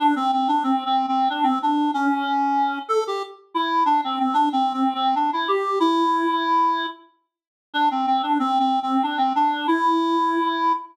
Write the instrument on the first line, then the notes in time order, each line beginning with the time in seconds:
clarinet
0.00 D4
0.16 C4
0.33 C4
0.48 D4
0.63 C4
0.86 C4
1.08 C4
1.30 D4
1.43 C4
1.62 D4
1.94 C#4
2.89 A4
3.07 G4
3.54 E4
3.86 D4
4.04 C4
4.19 C4
4.34 D4
4.52 C4
4.73 C4
4.94 C4
5.15 D4
5.33 E4
5.48 G4
5.80 E4
7.74 D4
7.91 C4
8.07 C4
8.23 D4
8.39 C4
8.59 C4
8.83 C4
9.03 D4
9.18 C4
9.35 D4
9.67 E4